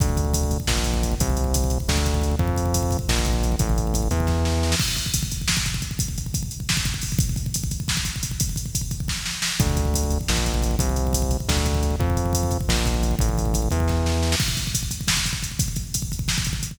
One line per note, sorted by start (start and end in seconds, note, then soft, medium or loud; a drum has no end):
0.00 0.58 D2 medium
0.00 kick loud
0.00 closed hi-hat loud
0.09 kick medium
0.17 kick loud
0.17 closed hi-hat medium
0.24 kick medium
0.34 kick loud
0.34 closed hi-hat loud
0.43 kick medium
0.51 kick medium
0.51 closed hi-hat medium
0.60 kick medium
0.67 1.15 A#1 medium
0.67 kick medium
0.67 snare loud
0.77 kick medium
0.84 kick medium
0.84 closed hi-hat medium
0.94 kick medium
1.03 kick medium
1.03 closed hi-hat medium
1.12 kick medium
1.20 1.78 C2 medium
1.20 kick loud
1.20 closed hi-hat loud
1.30 kick medium
1.37 kick medium
1.37 closed hi-hat medium
1.44 kick medium
1.54 kick loud
1.54 closed hi-hat loud
1.64 kick medium
1.70 kick medium
1.70 closed hi-hat medium
1.80 kick medium
1.88 2.36 D2 loud
1.88 kick loud
1.88 snare loud
1.97 kick medium
2.06 kick loud
2.06 closed hi-hat medium
2.14 kick medium
2.21 kick medium
2.21 closed hi-hat medium
2.31 kick medium
2.39 2.97 F2 loud
2.39 kick loud
2.47 kick medium
2.56 kick medium
2.56 closed hi-hat medium
2.66 kick medium
2.74 kick medium
2.74 closed hi-hat loud
2.83 kick medium
2.91 kick medium
2.91 closed hi-hat medium
2.99 kick medium
3.08 3.56 A#1 loud
3.08 kick medium
3.08 snare loud
3.19 kick medium
3.25 kick loud
3.25 closed hi-hat medium
3.33 kick medium
3.43 kick medium
3.43 closed hi-hat medium
3.52 kick medium
3.59 4.09 A1 loud
3.59 kick loud
3.59 closed hi-hat loud
3.69 kick medium
3.78 kick medium
3.78 closed hi-hat medium
3.87 kick medium
3.94 kick loud
3.94 closed hi-hat loud
4.02 kick medium
4.11 4.75 E2 loud
4.11 kick medium
4.11 closed hi-hat medium
4.20 kick medium
4.27 kick medium
4.27 snare medium
4.45 snare medium
4.63 snare medium
4.72 snare loud
4.79 kick loud
4.79 crash loud
4.88 kick medium
4.96 kick medium
4.96 closed hi-hat medium
5.06 kick medium
5.14 kick loud
5.14 closed hi-hat loud
5.23 kick loud
5.31 kick medium
5.31 closed hi-hat medium
5.41 kick medium
5.48 kick medium
5.48 snare loud
5.57 kick loud
5.66 kick medium
5.66 closed hi-hat medium
5.74 kick medium
5.82 kick medium
5.82 closed hi-hat medium
5.91 kick medium
5.99 kick loud
5.99 closed hi-hat loud
6.08 kick medium
6.18 kick medium
6.18 closed hi-hat medium
6.26 kick medium
6.34 kick loud
6.34 closed hi-hat loud
6.43 kick medium
6.51 closed hi-hat medium
6.60 kick medium
6.69 kick medium
6.69 snare loud
6.77 kick loud
6.85 kick loud
6.85 closed hi-hat medium
6.94 kick medium
7.01 kick medium
7.01 open hi-hat medium
7.12 kick medium
7.19 kick loud
7.19 closed hi-hat loud
7.29 kick medium
7.36 kick medium
7.36 closed hi-hat medium
7.46 kick medium
7.54 kick medium
7.54 closed hi-hat loud
7.64 kick loud
7.71 kick medium
7.71 closed hi-hat medium
7.80 kick medium
7.88 kick medium
7.88 snare loud
7.97 kick medium
8.05 kick medium
8.05 closed hi-hat medium
8.16 kick medium
8.23 kick medium
8.23 closed hi-hat loud
8.31 kick medium
8.40 kick loud
8.40 closed hi-hat loud
8.49 kick medium
8.56 kick medium
8.56 closed hi-hat medium
8.66 kick medium
8.75 kick medium
8.75 closed hi-hat loud
8.81 kick medium
8.91 kick medium
8.91 closed hi-hat medium
9.00 kick medium
9.08 kick medium
9.08 snare medium
9.26 snare medium
9.42 snare loud
9.60 10.18 D2 medium
9.60 kick loud
9.60 closed hi-hat loud
9.70 kick medium
9.77 kick loud
9.77 closed hi-hat medium
9.85 kick medium
9.94 kick loud
9.94 closed hi-hat loud
10.03 kick medium
10.10 kick medium
10.10 closed hi-hat medium
10.21 kick medium
10.28 10.76 A#1 medium
10.28 kick medium
10.28 snare loud
10.37 kick medium
10.46 kick medium
10.46 closed hi-hat medium
10.54 kick medium
10.62 kick medium
10.62 closed hi-hat medium
10.71 kick medium
10.79 11.37 C2 medium
10.79 kick loud
10.79 closed hi-hat loud
10.89 kick medium
10.96 kick medium
10.96 closed hi-hat medium
11.07 kick medium
11.13 kick loud
11.13 closed hi-hat loud
11.22 kick medium
11.31 kick medium
11.31 closed hi-hat medium
11.40 kick medium
11.48 11.96 D2 loud
11.48 kick loud
11.48 snare loud
11.58 kick medium
11.65 kick loud
11.65 closed hi-hat medium
11.75 kick medium
11.83 kick medium
11.83 closed hi-hat medium
11.91 kick medium
12.00 12.58 F2 loud
12.00 kick loud
12.10 kick medium
12.17 kick medium
12.17 closed hi-hat medium
12.26 kick medium
12.33 kick medium
12.33 closed hi-hat loud
12.43 kick medium
12.51 kick medium
12.51 closed hi-hat medium
12.61 kick medium
12.68 13.16 A#1 loud
12.68 kick medium
12.68 snare loud
12.77 kick medium
12.86 kick loud
12.86 closed hi-hat medium
12.94 kick medium
13.03 kick medium
13.03 closed hi-hat medium
13.11 kick medium
13.19 13.69 A1 loud
13.19 kick loud
13.19 closed hi-hat loud
13.29 kick medium
13.38 kick medium
13.38 closed hi-hat medium
13.45 kick medium
13.54 kick loud
13.54 closed hi-hat loud
13.62 kick medium
13.71 14.36 E2 loud
13.71 kick medium
13.71 closed hi-hat medium
13.80 kick medium
13.88 kick medium
13.88 snare medium
14.06 snare medium
14.23 snare medium
14.32 snare loud
14.40 kick loud
14.40 crash loud
14.48 kick medium
14.57 kick medium
14.57 closed hi-hat medium
14.67 kick medium
14.75 kick medium
14.75 closed hi-hat loud
14.83 kick medium
14.91 kick medium
14.91 closed hi-hat medium
15.01 kick medium
15.08 kick medium
15.08 snare loud
15.17 kick medium
15.26 kick medium
15.26 closed hi-hat medium
15.33 kick medium
15.43 kick medium
15.43 closed hi-hat medium
15.51 kick medium
15.59 kick loud
15.59 closed hi-hat loud
15.68 kick medium
15.76 kick medium
15.76 closed hi-hat medium
15.94 kick medium
15.94 closed hi-hat loud
16.02 kick medium
16.12 kick medium
16.12 closed hi-hat medium
16.19 kick medium
16.28 kick medium
16.28 snare loud
16.38 kick loud
16.44 kick medium
16.44 closed hi-hat medium
16.53 kick medium
16.63 kick medium
16.63 closed hi-hat medium
16.71 kick medium